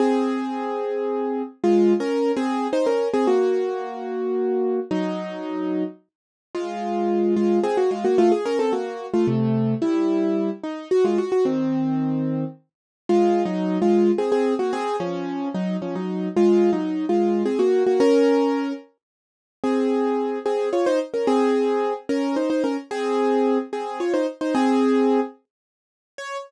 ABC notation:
X:1
M:3/4
L:1/16
Q:1/4=110
K:Db
V:1 name="Acoustic Grand Piano"
[CA]12 | (3[A,F]4 [DB]4 [CA]4 [Ec] [DB]2 [CA] | [B,G]12 | [G,E]8 z4 |
[K:Bbm] [A,F]6 [A,F]2 [CA] [B,G] [A,F] [B,G] | [=A,F] _A [DB] [C=A] [B,G]3 [A,F] [C,A,]4 | [=G,=E]6 _E2 _G [A,F] G G | [E,C]8 z4 |
[K:Db] (3[A,F]4 [G,E]4 [A,F]4 [CA] [CA]2 [B,G] | [CA]2 [F,D]4 [G,E]2 [F,D] [G,E]3 | (3[A,F]4 [G,E]4 [A,F]4 [CA] [B,G]2 [B,G] | [DB]6 z6 |
[CA]6 [CA]2 [Fd] [Ec] z [DB] | [CA]6 [DB]2 [Ec] [Ec] [DB] z | [CA]6 [CA]2 [Fd] [Ec] z [Ec] | [CA]6 z6 |
d4 z8 |]